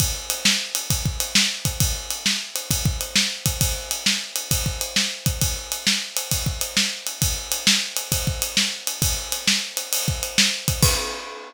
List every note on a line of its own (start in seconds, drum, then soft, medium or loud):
0.00 kick loud
0.00 ride loud
0.30 ride medium
0.45 snare loud
0.75 ride medium
0.90 kick loud
0.90 ride loud
1.05 kick medium
1.20 ride medium
1.35 snare loud
1.65 kick medium
1.65 ride medium
1.80 kick loud
1.80 ride loud
2.11 ride medium
2.26 snare loud
2.56 ride medium
2.71 kick loud
2.71 ride loud
2.85 kick loud
3.01 ride medium
3.16 snare loud
3.46 kick medium
3.46 ride medium
3.61 kick loud
3.61 ride loud
3.91 ride medium
4.06 snare loud
4.36 ride medium
4.51 kick loud
4.51 ride loud
4.66 kick medium
4.81 ride medium
4.96 snare loud
5.26 kick medium
5.26 ride medium
5.41 kick loud
5.41 ride loud
5.72 ride medium
5.87 snare loud
6.17 ride medium
6.31 kick medium
6.31 ride loud
6.46 kick medium
6.61 ride medium
6.77 snare loud
7.07 ride medium
7.22 kick loud
7.22 ride loud
7.52 ride medium
7.67 snare loud
7.97 ride medium
8.12 kick loud
8.12 ride loud
8.27 kick medium
8.42 ride medium
8.57 snare loud
8.87 ride medium
9.02 kick loud
9.02 ride loud
9.32 ride medium
9.47 snare loud
9.77 ride medium
9.93 ride loud
10.08 kick medium
10.23 ride medium
10.38 snare loud
10.68 kick medium
10.68 ride medium
10.83 kick loud
10.83 crash loud